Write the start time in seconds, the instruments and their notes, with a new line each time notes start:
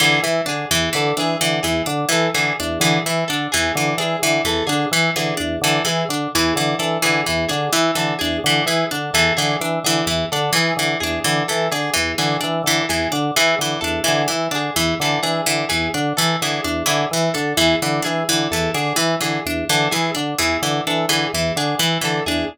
0.00 drawbar organ D3, pizzicato strings E3, orchestral harp G#4
0.22 drawbar organ E3, pizzicato strings E3
0.46 drawbar organ D3, pizzicato strings D4, orchestral harp G#4
0.71 drawbar organ E2, pizzicato strings E3
0.93 drawbar organ D3, pizzicato strings E3, orchestral harp A4
1.17 drawbar organ E3, pizzicato strings D4, orchestral harp G#4
1.41 drawbar organ D3, pizzicato strings E3
1.63 drawbar organ E2, pizzicato strings E3, orchestral harp G#4
1.86 drawbar organ D3, pizzicato strings D4
2.09 pizzicato strings E3, drawbar organ E3, orchestral harp A4
2.34 drawbar organ D3, pizzicato strings E3, orchestral harp G#4
2.60 drawbar organ E2, pizzicato strings D4
2.80 drawbar organ D3, pizzicato strings E3, orchestral harp G#4
3.06 drawbar organ E3, pizzicato strings E3
3.28 drawbar organ D3, pizzicato strings D4, orchestral harp A4
3.52 drawbar organ E2, pizzicato strings E3, orchestral harp G#4
3.75 drawbar organ D3, pizzicato strings E3
3.98 drawbar organ E3, pizzicato strings D4, orchestral harp G#4
4.22 drawbar organ D3, pizzicato strings E3
4.44 drawbar organ E2, pizzicato strings E3, orchestral harp A4
4.67 drawbar organ D3, pizzicato strings D4, orchestral harp G#4
4.91 drawbar organ E3, pizzicato strings E3
5.16 drawbar organ D3, pizzicato strings E3, orchestral harp G#4
5.37 drawbar organ E2, pizzicato strings D4
5.61 drawbar organ D3, pizzicato strings E3, orchestral harp A4
5.85 pizzicato strings E3, drawbar organ E3, orchestral harp G#4
6.09 drawbar organ D3, pizzicato strings D4
6.35 drawbar organ E2, pizzicato strings E3, orchestral harp G#4
6.56 drawbar organ D3, pizzicato strings E3
6.79 drawbar organ E3, pizzicato strings D4, orchestral harp A4
7.02 drawbar organ D3, pizzicato strings E3, orchestral harp G#4
7.26 drawbar organ E2, pizzicato strings E3
7.49 drawbar organ D3, pizzicato strings D4, orchestral harp G#4
7.72 drawbar organ E3, pizzicato strings E3
7.95 drawbar organ D3, pizzicato strings E3, orchestral harp A4
8.19 drawbar organ E2, pizzicato strings D4, orchestral harp G#4
8.44 drawbar organ D3, pizzicato strings E3
8.66 drawbar organ E3, pizzicato strings E3, orchestral harp G#4
8.91 drawbar organ D3, pizzicato strings D4
9.13 drawbar organ E2, pizzicato strings E3, orchestral harp A4
9.37 drawbar organ D3, pizzicato strings E3, orchestral harp G#4
9.61 drawbar organ E3, pizzicato strings D4
9.84 drawbar organ D3, pizzicato strings E3, orchestral harp G#4
10.06 drawbar organ E2, pizzicato strings E3
10.32 drawbar organ D3, pizzicato strings D4, orchestral harp A4
10.53 pizzicato strings E3, drawbar organ E3, orchestral harp G#4
10.77 drawbar organ D3, pizzicato strings E3
11.00 drawbar organ E2, pizzicato strings D4, orchestral harp G#4
11.24 drawbar organ D3, pizzicato strings E3
11.48 pizzicato strings E3, drawbar organ E3, orchestral harp A4
11.71 drawbar organ D3, pizzicato strings D4, orchestral harp G#4
11.94 drawbar organ E2, pizzicato strings E3
12.18 drawbar organ D3, pizzicato strings E3, orchestral harp G#4
12.41 drawbar organ E3, pizzicato strings D4
12.64 drawbar organ D3, pizzicato strings E3, orchestral harp A4
12.89 drawbar organ E2, pizzicato strings E3, orchestral harp G#4
13.12 drawbar organ D3, pizzicato strings D4
13.36 pizzicato strings E3, drawbar organ E3, orchestral harp G#4
13.59 drawbar organ D3, pizzicato strings E3
13.81 drawbar organ E2, pizzicato strings D4, orchestral harp A4
14.04 pizzicato strings E3, orchestral harp G#4
14.08 drawbar organ D3
14.28 pizzicato strings E3, drawbar organ E3
14.51 drawbar organ D3, pizzicato strings D4
14.55 orchestral harp G#4
14.76 drawbar organ E2, pizzicato strings E3
15.00 drawbar organ D3, pizzicato strings E3, orchestral harp A4
15.23 drawbar organ E3, pizzicato strings D4, orchestral harp G#4
15.46 drawbar organ D3, pizzicato strings E3
15.69 drawbar organ E2, pizzicato strings E3, orchestral harp G#4
15.94 drawbar organ D3, pizzicato strings D4
16.17 drawbar organ E3, pizzicato strings E3, orchestral harp A4
16.42 drawbar organ D3, pizzicato strings E3, orchestral harp G#4
16.64 drawbar organ E2, pizzicato strings D4
16.86 drawbar organ D3, pizzicato strings E3, orchestral harp G#4
17.11 drawbar organ E3, pizzicato strings E3
17.34 drawbar organ D3, pizzicato strings D4, orchestral harp A4
17.57 drawbar organ E2, pizzicato strings E3, orchestral harp G#4
17.82 drawbar organ D3, pizzicato strings E3
18.02 drawbar organ E3, pizzicato strings D4, orchestral harp G#4
18.29 drawbar organ D3, pizzicato strings E3
18.51 drawbar organ E2, pizzicato strings E3, orchestral harp A4
18.74 drawbar organ D3, pizzicato strings D4, orchestral harp G#4
18.96 pizzicato strings E3, drawbar organ E3
19.21 drawbar organ D3, pizzicato strings E3, orchestral harp G#4
19.46 drawbar organ E2, pizzicato strings D4
19.69 drawbar organ D3, pizzicato strings E3, orchestral harp A4
19.91 pizzicato strings E3, drawbar organ E3, orchestral harp G#4
20.15 drawbar organ D3, pizzicato strings D4
20.38 drawbar organ E2, pizzicato strings E3, orchestral harp G#4
20.62 drawbar organ D3, pizzicato strings E3
20.87 drawbar organ E3, pizzicato strings D4, orchestral harp A4
21.09 drawbar organ D3, pizzicato strings E3, orchestral harp G#4
21.33 drawbar organ E2, pizzicato strings E3
21.56 drawbar organ D3, pizzicato strings D4, orchestral harp G#4
21.79 drawbar organ E3, pizzicato strings E3
22.01 drawbar organ D3, pizzicato strings E3, orchestral harp A4
22.26 drawbar organ E2, pizzicato strings D4, orchestral harp G#4